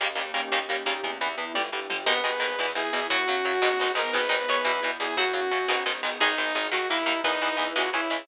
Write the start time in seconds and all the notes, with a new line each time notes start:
0.00 D#2 C#3 D#3 G3 A#3 C#4 D#4 G4, kick, crash
0.15 D#2 C#3 D#3 G3 A#3, ride
0.34 D#2 C#3 D#3 G3 A#3, ride
0.52 D#2 C#3 D#3 G3 A#3 C#4 D#4 G4, snare
0.69 D#2 C#3 D#3 G3 A#3, ride
0.86 D#2 C#3 D#3 G3 A#3, ride
1.03 E2 E3 B3 E4, kick, ride
1.20 E2 E3 B3, ride
1.38 E2 E3 B3, ride
1.54 G1 D3 G3 D4 G4, kick, high tom
1.72 G1 D3 G3
1.90 G1 D3 G3, mid tom
2.06 G#1 B2 D#3 G#3 B3 D#4 G#4 B4, kick, crash
2.24 G#1 B2 D#3 G#3, ride
2.40 G#1 B2 D#3 G#3, ride
2.59 E2 B2 E3 B3 E4, snare
2.75 E2 B2 E3 G#4, ride
2.93 E2 B2 E3, ride
3.09 F#2 C#3 F#3 C#4 F#4, kick, ride
3.27 F#2 C#3 F#3, ride
3.44 F#2 C#3 F#3, ride
3.62 G#1 B2 D#3 G#3 B3 D#4 G#4, snare
3.79 G#1 B2 D#3 G#3, ride
3.95 G#1 B2 D#3 G#3 A#4, ride
4.13 G#1 B2 D#3 G#3 B3 D#4 G#4 B4, kick, ride
4.29 G#1 B2 D#3 G#3, ride
4.48 G#1 B2 D#3 G#3 C#5, ride
4.64 E2 B2 E3 B3 E4 E5, snare
4.83 E2 B2 E3, ride
5.00 E2 B2 E3 G#4, ride
5.17 F#2 C#3 F#3 C#4 F#4, kick, ride
5.33 F#2 C#3 F#3, ride
5.51 F#2 C#3 F#3, ride
5.68 G#1 B2 D#3 G#3 B3 D#4 G#4, snare
5.86 G#1 B2 D#3 G#3, ride
6.03 G#1 B2 D#3 G#3, ride
6.20 G#1 D#3 G#3 D#4 G#4, kick, ride
6.38 G#1 D#3 G#3, ride
6.55 G#1 D#3 G#3, ride
6.71 D#2 D#3 A#3 D#4 F#4 A#4, snare
6.90 D#2 D#3 A#3 E4, ride
7.06 D#2 D#3 A#3, ride
7.24 E2 E3 B3 D#4 E4 B4, kick, ride
7.41 E2 E3 B3, ride
7.57 E2 E3 B3, ride
7.76 C#2 E3 G#3 C#4 E4 F#4 G#4 C#5, snare
7.93 C#2 E3 G#3 C#4 E4, ride
8.10 C#2 E3 G#3 C#4, ride